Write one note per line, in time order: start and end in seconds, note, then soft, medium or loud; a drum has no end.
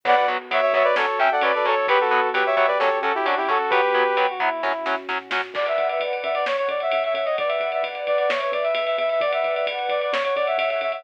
0.03 0.24 B1 loud
0.03 0.14 F#3 loud
0.03 0.94 B3 medium
0.03 0.14 B3 loud
0.03 0.94 F#4 medium
0.03 0.25 B4 medium
0.03 0.16 D5 medium
0.03 0.16 F#5 medium
0.03 kick loud
0.03 crash loud
0.16 0.27 D5 medium
0.16 0.27 F#5 medium
0.27 0.46 B1 medium
0.27 0.37 F#3 medium
0.27 0.37 B3 medium
0.50 0.70 B1 medium
0.50 0.60 F#3 medium
0.50 0.60 B3 medium
0.50 0.61 C#5 medium
0.50 0.61 E5 medium
0.50 ride loud
0.62 0.73 C#5 medium
0.62 0.73 E5 medium
0.73 0.93 B1 medium
0.73 0.83 F#3 medium
0.73 0.83 B3 medium
0.73 1.26 C#5 medium
0.73 0.85 C#5 medium
0.73 0.85 E5 medium
0.73 kick loud
0.84 0.95 B4 medium
0.84 0.95 D5 medium
0.96 1.15 F#2 loud
0.96 1.06 F#3 medium
0.96 1.06 C#4 loud
0.96 1.87 C#4 medium
0.96 1.86 F#4 medium
0.96 1.19 A4 medium
0.96 1.19 C#5 medium
0.96 snare loud
1.19 1.38 F#2 medium
1.19 1.29 F#3 medium
1.19 1.29 C#4 medium
1.19 1.30 E5 medium
1.19 1.30 G5 medium
1.31 1.42 A4 medium
1.31 1.43 D5 medium
1.31 1.43 F#5 medium
1.41 1.61 F#2 medium
1.41 1.52 F#3 medium
1.41 1.52 C#4 medium
1.41 1.54 B4 medium
1.41 1.54 D5 medium
1.41 ride loud
1.54 1.75 A4 medium
1.54 1.66 B4 medium
1.54 1.66 D5 medium
1.65 1.85 F#2 medium
1.65 1.75 F#3 medium
1.65 1.75 C#4 medium
1.65 1.87 A4 medium
1.65 1.87 C#5 medium
1.65 kick medium
1.76 1.87 A4 medium
1.86 2.07 B1 loud
1.86 1.97 F#3 medium
1.86 2.77 B3 medium
1.86 1.97 B3 medium
1.86 2.77 F#4 medium
1.86 1.99 G4 medium
1.86 1.99 B4 medium
1.86 2.28 B4 medium
1.86 kick loud
1.86 ride loud
2.00 2.30 F#4 medium
2.00 2.30 A4 medium
2.11 2.31 B1 medium
2.11 2.20 F#3 medium
2.11 2.20 B3 medium
2.33 2.53 B1 medium
2.33 2.43 F#3 medium
2.33 2.43 B3 medium
2.33 3.06 G4 medium
2.33 2.45 G4 medium
2.33 2.45 B4 medium
2.33 ride loud
2.46 2.55 C#5 medium
2.46 2.55 E5 medium
2.56 2.76 B1 medium
2.56 2.66 F#3 medium
2.56 2.66 B3 medium
2.56 2.67 C#5 medium
2.56 2.67 E5 medium
2.56 kick medium
2.67 2.78 B4 medium
2.67 2.78 D5 medium
2.79 3.00 F#2 loud
2.79 2.89 F#3 medium
2.79 3.70 C#4 medium
2.79 2.89 C#4 medium
2.79 3.70 F#4 medium
2.79 2.99 A4 medium
2.79 2.99 C#5 medium
2.79 snare medium
3.02 3.21 F#2 medium
3.02 3.12 F#3 medium
3.02 3.12 C#4 medium
3.02 3.13 F#4 medium
3.02 3.13 A4 medium
3.15 3.26 E4 medium
3.15 3.26 G4 medium
3.26 3.46 F#2 medium
3.26 3.35 F#3 medium
3.26 3.35 C#4 medium
3.26 3.37 D4 medium
3.26 3.37 F#4 medium
3.26 ride loud
3.37 3.48 E4 medium
3.37 3.48 G4 medium
3.48 3.69 F#2 medium
3.48 3.58 F#3 medium
3.48 3.58 C#4 medium
3.48 3.71 F#4 medium
3.48 3.71 A4 medium
3.48 kick medium
3.70 3.89 B1 medium
3.70 3.81 F#3 medium
3.70 4.61 B3 medium
3.70 3.81 B3 medium
3.70 4.61 F#4 medium
3.70 4.25 G4 medium
3.70 4.25 B4 medium
3.70 4.08 B4 loud
3.70 kick loud
3.70 ride loud
3.94 4.14 B1 medium
3.94 4.04 F#3 medium
3.94 4.04 B3 medium
4.17 4.37 B1 medium
4.17 4.26 F#3 medium
4.17 4.26 B3 medium
4.17 4.28 G4 medium
4.17 ride loud
4.29 4.40 F#4 medium
4.40 4.60 B1 medium
4.40 4.49 F#3 medium
4.40 4.49 B3 medium
4.40 4.96 E4 medium
4.40 kick medium
4.62 4.84 F#2 loud
4.62 4.72 F#3 medium
4.62 5.52 C#4 medium
4.62 4.72 C#4 medium
4.62 5.52 F#4 medium
4.62 kick medium
4.62 snare medium
4.86 5.06 F#2 medium
4.86 4.95 F#3 medium
4.86 4.95 C#4 medium
4.86 snare medium
5.09 5.29 A2 medium
5.09 5.18 F#3 medium
5.09 5.18 C#4 medium
5.09 snare medium
5.30 5.51 A#2 medium
5.30 5.41 F#3 medium
5.30 5.41 C#4 medium
5.30 snare loud
5.54 5.73 B1 loud
5.54 6.45 B4 medium
5.54 6.45 D5 loud
5.54 5.66 D5 loud
5.54 6.45 F#5 loud
5.54 kick loud
5.54 crash loud
5.66 5.87 E5 loud
5.66 ride medium
5.78 5.97 B1 loud
5.78 ride medium
5.89 6.01 E5 medium
5.89 ride medium
6.00 6.19 B1 medium
6.00 ride loud
6.13 ride medium
6.23 6.66 F#2 loud
6.23 6.34 E5 medium
6.23 ride medium
6.34 6.45 D5 loud
6.34 ride medium
6.46 7.37 C#5 medium
6.46 6.56 C#5 loud
6.46 7.37 F#5 medium
6.46 snare loud
6.57 6.68 C#5 loud
6.57 ride medium
6.68 6.88 F#2 loud
6.68 6.80 D5 medium
6.68 ride medium
6.80 6.91 E5 medium
6.80 ride medium
6.92 7.12 F#2 loud
6.92 7.03 E5 loud
6.92 ride loud
7.04 7.14 E5 loud
7.04 ride medium
7.14 7.34 F#2 loud
7.14 7.25 E5 medium
7.14 ride loud
7.25 7.36 D#5 loud
7.25 ride medium
7.38 7.58 B1 loud
7.38 8.28 B4 medium
7.38 8.29 D5 loud
7.38 7.49 D5 loud
7.38 8.29 F#5 medium
7.38 kick loud
7.38 ride loud
7.48 7.70 E5 medium
7.48 ride medium
7.60 7.79 B1 medium
7.60 ride medium
7.72 7.84 E5 medium
7.72 ride medium
7.83 8.02 B1 medium
7.83 ride loud
7.95 ride medium
8.07 8.27 B1 loud
8.07 8.18 D5 loud
8.07 ride medium
8.18 8.30 D5 loud
8.18 ride medium
8.29 8.49 E2 loud
8.29 9.19 B4 medium
8.29 8.40 C#5 medium
8.29 9.19 E5 medium
8.29 snare loud
8.40 8.51 C#5 loud
8.40 ride medium
8.52 8.71 E2 loud
8.52 8.63 D5 medium
8.52 ride loud
8.63 8.74 E5 medium
8.63 ride medium
8.74 8.94 E2 loud
8.74 8.85 E5 loud
8.74 ride loud
8.86 8.96 E5 loud
8.86 ride medium
8.98 9.18 E2 loud
8.98 9.09 E5 loud
8.98 ride medium
9.09 9.21 E5 loud
9.09 ride medium
9.20 9.39 B1 loud
9.20 10.10 B4 loud
9.20 10.10 D5 medium
9.20 9.31 D5 loud
9.20 10.10 F#5 loud
9.20 kick loud
9.20 ride loud
9.33 9.54 E5 loud
9.33 ride loud
9.44 9.63 B1 medium
9.44 ride medium
9.55 9.66 E5 medium
9.55 ride medium
9.66 9.86 B1 medium
9.66 ride loud
9.79 ride medium
9.89 10.08 B1 loud
9.89 10.01 D5 medium
9.89 ride medium
10.01 10.12 D5 medium
10.01 ride medium
10.12 10.32 F#2 loud
10.12 10.23 C#5 loud
10.12 11.04 C#5 medium
10.12 11.04 F#5 loud
10.12 snare loud
10.24 10.35 C#5 loud
10.24 ride medium
10.35 10.55 F#2 loud
10.35 10.46 D5 loud
10.35 ride medium
10.47 10.58 E5 medium
10.47 ride medium
10.58 10.77 F#2 medium
10.58 10.69 E5 loud
10.58 ride loud
10.70 10.81 E5 medium
10.70 ride medium
10.81 11.00 F#2 medium
10.81 10.92 E5 loud
10.81 ride medium
10.92 11.03 E5 loud
10.92 ride medium